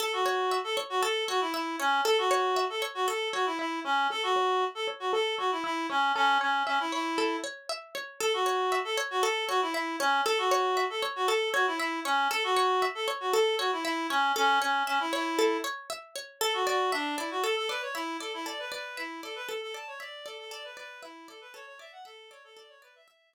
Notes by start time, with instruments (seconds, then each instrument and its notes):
0.00 clarinet A4, pizzicato strings A4
0.13 clarinet F#4
0.26 pizzicato strings C#5
0.51 pizzicato strings E5
0.64 clarinet A4
0.77 pizzicato strings C#5
0.90 clarinet F#4
1.02 pizzicato strings A4, clarinet A4
1.28 clarinet F#4, pizzicato strings C#5
1.41 clarinet E4
1.54 clarinet E4, pizzicato strings E5
1.79 clarinet C#4, pizzicato strings C#5
2.05 clarinet A4, pizzicato strings A4
2.18 clarinet F#4
2.31 pizzicato strings C#5
2.56 pizzicato strings E5
2.70 clarinet A4
2.82 pizzicato strings C#5
2.95 clarinet F#4
3.08 clarinet A4, pizzicato strings A4
3.33 clarinet F#4, pizzicato strings C#5
3.46 clarinet E4
3.59 clarinet E4, pizzicato strings E5
3.84 clarinet C#4, pizzicato strings C#5
4.10 pizzicato strings A4, clarinet A4
4.23 clarinet F#4
4.36 pizzicato strings C#5
4.62 pizzicato strings E5
4.75 clarinet A4
4.87 pizzicato strings C#5
5.00 clarinet F#4
5.13 clarinet A4, pizzicato strings A4
5.38 clarinet F#4, pizzicato strings C#5
5.51 clarinet E4
5.64 clarinet E4, pizzicato strings E5
5.90 clarinet C#4, pizzicato strings C#5
6.15 clarinet C#4, pizzicato strings A4
6.41 clarinet C#4, pizzicato strings C#5
6.67 clarinet C#4, pizzicato strings E5
6.80 clarinet E4
6.92 clarinet E4, pizzicato strings C#5
7.18 pizzicato strings A4
7.44 pizzicato strings C#5
7.69 pizzicato strings E5
7.95 pizzicato strings C#5
8.20 clarinet A4, pizzicato strings A4
8.34 clarinet F#4
8.46 pizzicato strings C#5
8.72 pizzicato strings E5
8.85 clarinet A4
8.97 pizzicato strings C#5
9.11 clarinet F#4
9.23 pizzicato strings A4, clarinet A4
9.48 clarinet F#4, pizzicato strings C#5
9.62 clarinet E4
9.74 clarinet E4, pizzicato strings E5
10.00 clarinet C#4, pizzicato strings C#5
10.26 pizzicato strings A4, clarinet A4
10.38 clarinet F#4
10.51 pizzicato strings C#5
10.77 pizzicato strings E5
10.90 clarinet A4
11.02 pizzicato strings C#5
11.16 clarinet F#4
11.28 clarinet A4, pizzicato strings A4
11.54 clarinet F#4, pizzicato strings C#5
11.67 clarinet E4
11.79 clarinet E4, pizzicato strings E5
12.05 clarinet C#4, pizzicato strings C#5
12.31 pizzicato strings A4, clarinet A4
12.44 clarinet F#4
12.57 pizzicato strings C#5
12.82 pizzicato strings E5
12.95 clarinet A4
13.08 pizzicato strings C#5
13.20 clarinet F#4
13.33 clarinet A4, pizzicato strings A4
13.59 clarinet F#4, pizzicato strings C#5
13.72 clarinet E4
13.85 clarinet E4, pizzicato strings E5
14.10 clarinet C#4, pizzicato strings C#5
14.36 clarinet C#4, pizzicato strings A4
14.61 clarinet C#4, pizzicato strings C#5
14.87 clarinet C#4, pizzicato strings E5
15.00 clarinet E4
15.13 clarinet E4, pizzicato strings C#5
15.39 pizzicato strings A4
15.64 pizzicato strings C#5
15.90 pizzicato strings E5
16.15 pizzicato strings C#5
16.41 clarinet A4, pizzicato strings A4
16.54 clarinet F#4
16.67 clarinet F#4, pizzicato strings D5
16.92 clarinet D4, pizzicato strings E5
17.18 clarinet E4, pizzicato strings D5
17.31 clarinet F#4
17.43 clarinet A4, pizzicato strings A4
17.57 clarinet A4
17.69 clarinet B4, pizzicato strings D5
17.82 clarinet C#5
17.94 clarinet E4, pizzicato strings E5
18.20 clarinet A4, pizzicato strings D5
18.34 clarinet E4
18.46 pizzicato strings A4, clarinet D5
18.59 clarinet B4
18.72 clarinet B4, pizzicato strings D5
18.97 clarinet E4, pizzicato strings E5
19.23 clarinet A4, pizzicato strings D5
19.36 clarinet B4
19.48 clarinet A4, pizzicato strings A4
19.62 clarinet A4
19.74 pizzicato strings D5, clarinet A5
19.87 clarinet C#5
20.00 clarinet D5, pizzicato strings E5
20.25 clarinet A4, pizzicato strings D5
20.39 clarinet A4
20.51 pizzicato strings A4, clarinet D5
20.64 clarinet B4
20.77 clarinet B4, pizzicato strings D5
21.02 clarinet E4, pizzicato strings E5
21.28 clarinet A4, pizzicato strings D5
21.41 clarinet B4
21.54 pizzicato strings A4, clarinet C#5
21.67 clarinet C#5
21.79 pizzicato strings D5, clarinet E5
21.92 clarinet F#5
22.05 clarinet A4, pizzicato strings E5
22.31 clarinet C#5, pizzicato strings D5
22.44 clarinet A4
22.57 pizzicato strings A4, clarinet D5
22.69 clarinet C#5
22.82 clarinet B4, pizzicato strings D5
22.95 clarinet E5
23.08 pizzicato strings E5
23.33 pizzicato strings D5